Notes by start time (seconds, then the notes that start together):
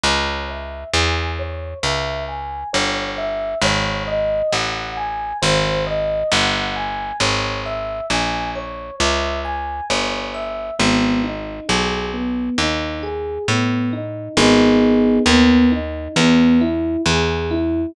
0.03 C#2 C#5
0.49 E5
0.93 E2 G#5
1.39 C#5
1.83 C#2 E5
2.28 G#5
2.73 G1 C#5
3.18 E5
3.61 G#1 C#5
4.07 D#5
4.52 A1 F#5
4.97 G#5
5.42 G#1 C5
5.87 D#5
6.32 G1 F#5
6.76 G#5
7.20 G#1 C#5
7.66 E5
8.10 A#1 G#5
8.55 C#5
9.00 C#2 E5
9.45 G#5
9.90 G1 C#5
10.34 E5
10.79 G#1 B3
11.24 D#4
11.68 B1 G#4
12.14 B3
12.58 D#2 D#4
13.03 G#4
13.48 A2 B3
13.93 D#4
14.37 G#1 B3 D#4 G#4
15.26 D#2 B3
15.72 D#4
16.16 E2 B3
16.61 E4
17.06 E2 G#4
17.51 E4